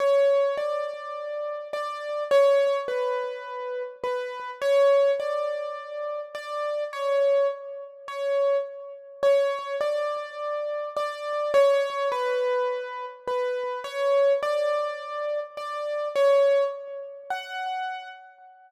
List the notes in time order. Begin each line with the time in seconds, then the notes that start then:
0.00 C#5
0.57 D5
1.73 D5
2.31 C#5
2.88 B4
4.04 B4
4.62 C#5
5.20 D5
6.35 D5
6.93 C#5
8.08 C#5
9.23 C#5
9.81 D5
10.97 D5
11.54 C#5
12.12 B4
13.28 B4
13.84 C#5
14.43 D5
15.57 D5
16.16 C#5
17.30 F#5